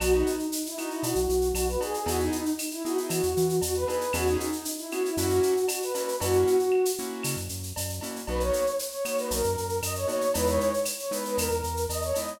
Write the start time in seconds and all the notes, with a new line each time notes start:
0.00 B1 B3 D#4 F#4, cowbell, claves, shaker
0.12 D#4
0.27 shaker
0.39 shaker
0.52 shaker
0.66 E4, shaker
0.78 B3 D#4 F#4, claves, shaker
0.91 E4, shaker
1.03 B2 F#4, cowbell, shaker
1.15 B1, shaker
1.29 B1, shaker
1.41 shaker
1.54 B1 F#4, cowbell, claves, shaker
1.68 B4, shaker
1.80 B3 D#4 F#4 G#4, cowbell, shaker
1.94 shaker
2.06 E2 B3 D#4 E4 F#4 G#4, cowbell, shaker
2.20 D#4, shaker
2.32 shaker
2.46 shaker
2.59 claves, shaker
2.71 E4, shaker
2.85 B3 D#4 E4 F#4 G#4, shaker
2.97 E4, shaker
3.09 E3 F#4, cowbell, claves, shaker
3.23 E2, shaker
3.37 E3, shaker
3.49 shaker
3.62 E2 F#4, cowbell, shaker
3.74 B4, shaker
3.87 B3 D#4 E4 G#4 B4, cowbell, shaker
4.01 shaker
4.13 E2 B3 C#4 E4 F#4 G#4, cowbell, claves, shaker
4.27 D#4, shaker
4.40 shaker
4.52 shaker
4.65 shaker
4.78 E4, shaker
4.90 B3 C#4 E4 F#4 G#4, claves, shaker
5.05 E4, shaker
5.17 F#2 A#3 C#4 E4 F#4, cowbell, shaker
5.30 shaker
5.43 shaker
5.57 shaker
5.68 F#4, cowbell, claves, shaker
5.82 B4, shaker
5.95 A#3 C#4 E4 F#4 B4, cowbell, shaker
6.08 shaker
6.20 F#2 A#3 C#4 E4 F#4, cowbell, shaker
6.33 shaker
6.47 shaker
6.59 shaker
6.72 claves
6.85 shaker
6.98 A#3 C#4 E4 F#4, shaker
7.23 C#3, cowbell, claves, shaker
7.37 F#2, shaker
7.49 F#2, shaker
7.63 shaker
7.76 F#2, cowbell, shaker
7.89 shaker
8.01 A#3 C#4 E4 F#4, cowbell, shaker
8.16 shaker
8.27 B1 A#3 B3 D#4 F#4 B4, cowbell, shaker
8.40 C#5, shaker
8.53 shaker
8.66 shaker
8.79 shaker
8.91 C#5, shaker
9.05 A#3 B3 D#4 F#4 C#5, claves, shaker
9.17 B4, shaker
9.31 B1 A#4, cowbell, shaker
9.44 F#2, shaker
9.58 F#2, shaker
9.69 shaker
9.82 F#2 D#5, cowbell, claves, shaker
9.95 C#5, shaker
10.08 A#3 B3 D#4 F#4 C#5, cowbell, shaker
10.21 shaker
10.34 E2 G#3 B3 D#4 E4 B4, cowbell, shaker
10.47 C#5, shaker
10.60 shaker
10.74 shaker
10.85 claves, shaker
10.99 C#5, shaker
11.11 G#3 B3 D#4 E4 B4, shaker
11.25 B4, shaker
11.37 E2 A#4, cowbell, claves, shaker
11.51 E2, shaker
11.64 E2, shaker
11.77 shaker
11.89 E2 D#5, cowbell, shaker
12.02 C#5, shaker
12.14 G#3 B3 D#4 E4 D#5, cowbell, shaker
12.28 shaker